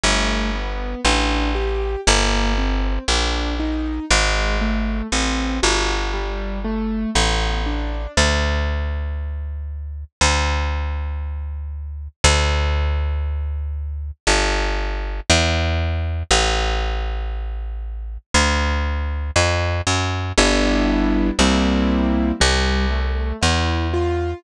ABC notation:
X:1
M:4/4
L:1/8
Q:1/4=59
K:Gmix
V:1 name="Acoustic Grand Piano"
A, B, D G _B, C D _E | _A, =A, C _G =G, A, B, D | [K:Dmix] z8 | z8 |
z8 | [K:Gmix] [G,B,DE]2 [G,_B,CE]2 G, A, E F |]
V:2 name="Electric Bass (finger)" clef=bass
G,,,2 A,,,2 G,,,2 _B,,,2 | _A,,,2 =A,,, G,,,3 A,,,2 | [K:Dmix] D,,4 D,,4 | D,,4 G,,,2 E,,2 |
A,,,4 D,,2 =F,, ^F,, | [K:Gmix] G,,,2 C,,2 C,,2 E,,2 |]